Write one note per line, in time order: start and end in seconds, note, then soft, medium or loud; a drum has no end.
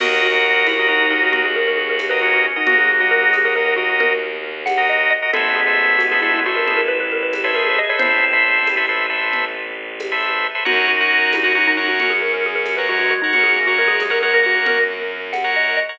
0.00 2.45 D#2 loud
0.00 1.13 F#4 medium
0.00 0.27 F#4 loud
0.00 0.22 F#4 loud
0.00 1.13 A#4 loud
0.00 0.27 A#4 loud
0.00 0.27 D#5 loud
0.00 crash loud
0.00 low conga loud
0.22 0.58 F#4 medium
0.32 0.67 F#4 medium
0.32 0.67 A#4 medium
0.32 0.67 D#5 medium
0.66 0.78 E4 medium
0.66 tambourine medium
0.66 high conga medium
0.78 0.89 F#4 medium
0.78 0.88 F#4 medium
0.78 0.88 A#4 medium
0.78 0.88 D#5 loud
0.88 1.00 D#4 medium
0.88 1.06 F#4 loud
0.88 1.06 A#4 medium
0.88 1.06 D#5 medium
1.01 1.11 D#4 medium
1.10 1.22 D#4 medium
1.10 1.46 F#4 medium
1.10 1.46 A#4 medium
1.10 1.46 D#5 medium
1.22 1.32 F#4 loud
1.33 1.43 F#4 medium
1.33 2.06 F#4 medium
1.33 low conga medium
1.45 1.55 G#4 medium
1.56 1.67 A#4 medium
1.67 1.78 A#4 medium
1.78 1.89 G#4 medium
1.89 2.00 A#4 medium
1.99 tambourine medium
1.99 high conga medium
2.10 2.46 F#4 medium
2.10 2.46 A#4 loud
2.10 2.20 B4 loud
2.10 2.46 D#5 medium
2.22 2.60 C#4 medium
2.22 2.32 F#4 medium
2.34 2.44 F#4 medium
2.46 2.57 F#4 medium
2.56 2.67 D#4 medium
2.56 2.92 F#4 medium
2.56 2.92 A#4 medium
2.56 2.92 D#5 medium
2.67 5.12 D#2 medium
2.67 3.47 F#3 medium
2.67 3.47 A#3 medium
2.67 2.78 F#4 loud
2.67 low conga loud
2.78 2.88 G#4 medium
3.00 3.11 F#4 loud
3.00 3.36 F#4 loud
3.00 3.36 A#4 medium
3.00 3.36 D#5 medium
3.11 3.21 A#4 loud
3.23 3.33 G#4 medium
3.33 3.44 G#4 loud
3.33 tambourine medium
3.33 high conga medium
3.45 3.54 F#4 medium
3.45 3.55 A#4 medium
3.45 3.54 A#4 medium
3.45 3.54 D#5 medium
3.55 3.74 F#4 medium
3.55 3.65 A#4 medium
3.55 3.74 A#4 medium
3.55 3.74 D#5 medium
3.66 3.76 A#4 medium
3.76 3.87 F#4 medium
3.76 4.13 F#4 medium
3.76 4.13 A#4 medium
3.76 4.13 D#5 medium
3.89 4.00 F#4 medium
4.00 4.38 A#4 medium
4.00 low conga medium
4.66 4.86 F#5 medium
4.66 tambourine medium
4.66 high conga medium
4.77 5.13 F#4 medium
4.77 5.13 A#4 medium
4.77 5.13 D#5 loud
4.89 5.08 D#5 medium
5.10 5.30 D#5 medium
5.22 5.31 F#4 medium
5.22 5.31 A#4 medium
5.22 5.31 D#5 medium
5.33 7.79 A1 loud
5.33 6.44 G#3 medium
5.33 6.44 B3 medium
5.33 5.54 A4 loud
5.33 5.61 A4 loud
5.33 5.61 B4 loud
5.33 5.61 C5 loud
5.33 5.61 E5 loud
5.33 low conga loud
5.56 5.95 G#4 medium
5.67 6.02 A4 medium
5.67 6.02 B4 medium
5.67 6.02 C5 medium
5.67 6.02 E5 medium
5.98 6.09 F#4 medium
5.98 tambourine medium
5.98 high conga medium
6.11 6.22 G#4 medium
6.11 6.20 A4 medium
6.11 6.20 B4 medium
6.11 6.20 C5 medium
6.11 6.20 E5 medium
6.21 6.32 E4 medium
6.21 6.40 A4 loud
6.21 6.40 B4 loud
6.21 6.40 C5 medium
6.21 6.40 E5 medium
6.33 6.44 E4 medium
6.46 6.57 F#4 medium
6.46 6.81 A4 medium
6.46 6.81 B4 medium
6.46 6.81 C5 loud
6.46 6.81 E5 medium
6.56 6.67 A#4 medium
6.66 7.53 E4 medium
6.66 6.78 G#4 medium
6.66 low conga medium
6.77 6.87 A#4 medium
6.88 6.99 B4 loud
7.00 7.11 B4 medium
7.12 7.22 A#4 medium
7.23 7.33 B4 medium
7.33 tambourine medium
7.33 high conga medium
7.44 7.79 A4 medium
7.44 7.79 B4 loud
7.44 7.79 C5 medium
7.44 7.55 C#5 medium
7.44 7.79 E5 medium
7.55 7.94 G#4 medium
7.55 7.66 A#4 medium
7.67 7.77 G#4 medium
7.79 7.89 D#5 medium
7.89 8.25 A4 medium
7.89 8.25 B4 medium
7.89 8.25 C5 medium
7.89 8.00 C#5 loud
7.89 8.25 E5 medium
7.99 10.45 A1 medium
7.99 8.75 C4 medium
7.99 8.75 E4 loud
7.99 8.99 C5 loud
7.99 low conga loud
8.33 8.68 A4 medium
8.33 8.68 B4 medium
8.33 8.68 C5 medium
8.33 8.68 E5 medium
8.67 tambourine medium
8.67 high conga medium
8.77 8.86 A4 loud
8.77 8.86 B4 medium
8.77 8.86 C5 medium
8.77 8.86 E5 medium
8.89 9.06 A4 medium
8.89 9.06 B4 medium
8.89 9.06 C5 medium
8.89 9.06 E5 medium
9.10 9.45 A4 loud
9.10 9.45 B4 medium
9.10 9.45 C5 medium
9.10 9.45 E5 medium
9.33 low conga medium
10.00 tambourine medium
10.00 high conga medium
10.12 10.47 A4 medium
10.12 10.47 B4 medium
10.12 10.47 C5 medium
10.12 10.47 E5 loud
10.55 10.64 A4 medium
10.55 10.64 B4 medium
10.55 10.64 C5 medium
10.55 10.64 E5 medium
10.65 13.12 F#2 loud
10.65 11.73 D#4 medium
10.65 11.73 F#4 medium
10.65 10.86 F#4 loud
10.65 10.92 A#4 loud
10.65 10.92 C#5 loud
10.65 10.92 F#5 loud
10.65 low conga loud
10.88 11.29 F#4 medium
11.01 11.36 A#4 loud
11.01 11.36 C#5 medium
11.01 11.36 F#5 medium
11.32 11.44 E4 medium
11.32 tambourine medium
11.32 high conga medium
11.44 11.56 F#4 medium
11.44 11.53 A#4 medium
11.44 11.53 C#5 medium
11.44 11.53 F#5 loud
11.55 11.67 D#4 medium
11.55 11.73 A#4 medium
11.55 11.73 C#5 loud
11.55 11.73 F#5 loud
11.67 11.78 D#4 loud
11.77 11.90 D#4 medium
11.77 12.12 A#4 medium
11.77 12.12 C#5 medium
11.77 12.12 F#5 medium
11.88 11.99 F#4 medium
12.00 12.76 C#4 medium
12.00 12.12 F#4 medium
12.00 low conga medium
12.10 12.21 G#4 medium
12.22 12.32 A#4 medium
12.34 12.44 A#4 medium
12.46 12.57 G#4 medium
12.55 12.66 A#4 medium
12.66 tambourine medium
12.66 high conga medium
12.77 13.14 A#4 medium
12.77 12.88 B4 medium
12.77 13.14 C#5 medium
12.77 13.14 F#5 medium
12.89 13.31 G#3 medium
12.89 12.99 F#4 loud
12.99 13.10 F#4 medium
13.11 13.21 F#4 medium
13.22 13.32 D#4 medium
13.22 13.59 A#4 medium
13.22 13.59 C#5 loud
13.22 13.59 F#5 medium
13.33 15.79 F#2 medium
13.33 13.53 C#4 medium
13.33 13.45 F#4 loud
13.33 low conga medium
13.44 13.54 G#4 medium
13.55 13.73 A#3 medium
13.67 13.77 F#4 medium
13.67 14.03 A#4 loud
13.67 14.03 C#5 medium
13.67 14.03 F#5 medium
13.78 13.96 G#3 medium
13.78 13.89 A#4 medium
13.88 13.98 G#4 loud
14.00 14.10 G#3 medium
14.00 14.12 G#4 medium
14.00 tambourine medium
14.00 high conga medium
14.10 14.19 A#4 medium
14.10 14.22 A#4 loud
14.10 14.19 C#5 medium
14.10 14.19 F#5 loud
14.22 14.33 G#3 medium
14.22 14.33 A#4 medium
14.22 14.40 A#4 medium
14.22 14.40 C#5 medium
14.22 14.40 F#5 medium
14.34 14.84 A#3 medium
14.34 14.45 A#4 loud
14.43 14.55 F#4 medium
14.43 14.79 A#4 medium
14.43 14.79 C#5 medium
14.43 14.79 F#5 loud
14.55 14.66 F#4 medium
14.66 15.09 A#4 loud
14.66 low conga loud
15.33 15.51 F#5 medium
15.33 tambourine medium
15.33 high conga medium
15.44 15.80 A#4 medium
15.44 15.80 C#5 medium
15.44 15.80 F#5 medium
15.56 15.75 D#5 medium
15.77 15.97 D#5 medium
15.89 15.98 A#4 medium
15.89 15.98 C#5 loud
15.89 15.98 F#5 medium